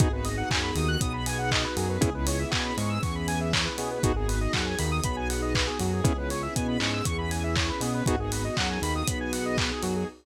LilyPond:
<<
  \new Staff \with { instrumentName = "Lead 2 (sawtooth)" } { \time 4/4 \key gis \minor \tempo 4 = 119 <b dis' fis' gis'>8 r8 fis8 dis8 b4. fis8 | <b cis' e' gis'>8 r8 b8 gis8 e4. b8 | <b dis' fis' gis'>8 r8 fis8 dis8 b4. fis8 | <b cis' e' gis'>8 r8 b8 gis8 e4. b8 |
<b dis' fis' gis'>8 r8 fis8 dis8 b4. fis8 | }
  \new Staff \with { instrumentName = "Lead 1 (square)" } { \time 4/4 \key gis \minor gis'16 b'16 dis''16 fis''16 gis''16 b''16 dis'''16 fis'''16 dis'''16 b''16 gis''16 fis''16 dis''16 b'16 gis'16 b'16 | gis'16 b'16 cis''16 e''16 gis''16 b''16 cis'''16 e'''16 cis'''16 b''16 gis''16 e''16 cis''16 b'16 gis'16 b'16 | fis'16 gis'16 b'16 dis''16 fis''16 gis''16 b''16 dis'''16 b''16 gis''16 fis''16 dis''16 b'16 gis'16 fis'16 gis'16 | gis'16 b'16 cis''16 e''16 gis''16 b''16 cis'''16 e'''16 cis'''16 b''16 gis''16 e''16 cis''16 b'16 gis'16 b'16 |
fis'16 gis'16 b'16 dis''16 fis''16 gis''16 b''16 dis'''16 b''16 gis''16 fis''16 dis''16 b'16 gis'16 fis'16 gis'16 | }
  \new Staff \with { instrumentName = "Synth Bass 1" } { \clef bass \time 4/4 \key gis \minor gis,,4 fis,8 dis,8 b,,4. fis,8 | cis,4 b,8 gis,8 e,4. b,8 | gis,,4 fis,8 dis,8 b,,4. fis,8 | cis,4 b,8 gis,8 e,4. b,8 |
gis,,4 fis,8 dis,8 b,,4. fis,8 | }
  \new Staff \with { instrumentName = "String Ensemble 1" } { \time 4/4 \key gis \minor <b dis' fis' gis'>1 | <b cis' e' gis'>1 | <b dis' fis' gis'>1 | <b cis' e' gis'>1 |
<b dis' fis' gis'>1 | }
  \new DrumStaff \with { instrumentName = "Drums" } \drummode { \time 4/4 <hh bd>8 hho8 <hc bd>8 hho8 <hh bd>8 hho8 <hc bd>8 hho8 | <hh bd>8 hho8 <hc bd>8 hho8 <hho bd>8 hho8 <hc bd>8 hho8 | <hh bd>8 hho8 <hc bd>8 hho8 <hh bd>8 hho8 <hc bd>8 hho8 | <hh bd>8 hho8 <hh bd>8 hc8 <hh bd>8 hho8 <hc bd>8 hho8 |
<hh bd>8 hho8 <hc bd>8 hho8 <hh bd>8 hho8 <hc bd>8 hho8 | }
>>